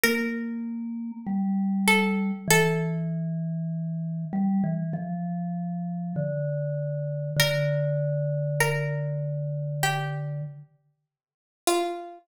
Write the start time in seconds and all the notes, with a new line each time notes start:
0.03 A#3 A#4
1.27 G3
1.88 A4
2.48 E3 A4
4.33 G3
4.64 E3
4.93 F3
6.16 D3
7.36 D3 A#4
8.60 A#4
9.83 G4
11.67 F4